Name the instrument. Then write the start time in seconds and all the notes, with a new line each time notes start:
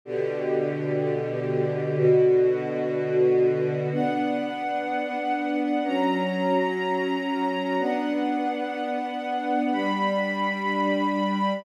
string ensemble 1
0.05 B2 D3 G4
1.97 B2 D3 F#4
3.91 B3 D4 F#5
5.85 F#3 C#4 A#5
7.78 B3 D4 F#5
9.71 G3 D4 B5